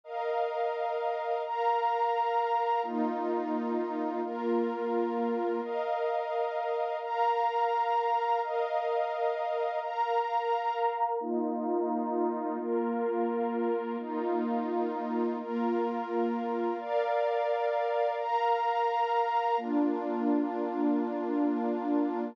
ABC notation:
X:1
M:6/8
L:1/8
Q:3/8=86
K:Bbmix
V:1 name="Pad 2 (warm)"
[Bef]6 | [Bfb]6 | [B,EF]6 | [B,FB]6 |
[Bef]6 | [Bfb]6 | [Bef]6 | [Bfb]6 |
[B,EF]6 | [B,FB]6 | [B,EF]6 | [B,FB]6 |
[Bdf]6 | [Bfb]6 | [B,DF]6- | [B,DF]6 |]